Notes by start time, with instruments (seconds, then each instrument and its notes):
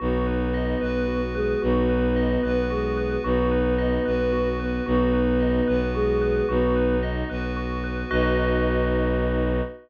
0.00 violin B1, pad 5 (bowed) B3 D#4 F#4, choir aahs B3 B4, tubular bells F#4
0.27 tubular bells B4
0.54 tubular bells D#5
0.81 violin B1, pad 5 (bowed) B3 F#4 B4, tubular bells B4
1.08 tubular bells F#4
1.34 choir aahs G#3 G#4, tubular bells B4
1.62 violin B1, pad 5 (bowed) B3 D#4 F#4, choir aahs B3 B4, tubular bells F#4
1.89 tubular bells B4
2.16 tubular bells D#5
2.43 violin B1, pad 5 (bowed) B3 F#4 B4, tubular bells B4
2.70 choir aahs G#3 G#4, tubular bells F#4
2.97 tubular bells B4
3.24 violin B1, pad 5 (bowed) B3 D#4 F#4, choir aahs B3 B4, tubular bells F#4
3.51 tubular bells B4
3.78 tubular bells D#5
4.05 violin B1, pad 5 (bowed) B3 F#4 B4, tubular bells B4
4.32 tubular bells F#4
4.59 choir aahs B3 B4, tubular bells B4
4.86 violin B1, pad 5 (bowed) B3 D#4 F#4, choir aahs B3 B4, tubular bells F#4
5.14 tubular bells B4
5.41 tubular bells D#5
5.67 violin B1, pad 5 (bowed) B3 F#4 B4, tubular bells B4
5.94 choir aahs G#3 G#4, tubular bells F#4
6.22 tubular bells B4
6.49 violin B1, pad 5 (bowed) B3 D#4 F#4, choir aahs B3 B4, tubular bells F#4
6.76 tubular bells B4
7.03 tubular bells D#5
7.30 violin B1, pad 5 (bowed) B3 F#4 B4, tubular bells B4
7.57 tubular bells F#4
7.84 tubular bells B4
8.11 violin B1, pad 5 (bowed) B3 D#4 F#4, tubular bells F#4 B4 D#5, choir aahs B4